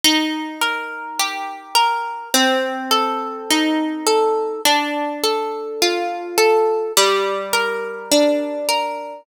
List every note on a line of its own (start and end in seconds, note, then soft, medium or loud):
0.05 2.24 D#4 loud
0.62 1.75 A#4 medium
1.19 2.29 G4 medium
1.75 2.30 A#4 medium
2.34 4.53 C4 loud
2.91 4.06 A4 medium
3.50 4.60 D#4 medium
4.07 4.62 A4 medium
4.65 6.85 D4 medium
5.24 6.37 A4 medium
5.82 6.92 F4 medium
6.38 6.93 A4 medium
6.97 9.16 G3 medium
7.53 8.68 A#4 medium
8.12 9.21 D4 medium
8.69 9.24 A#4 medium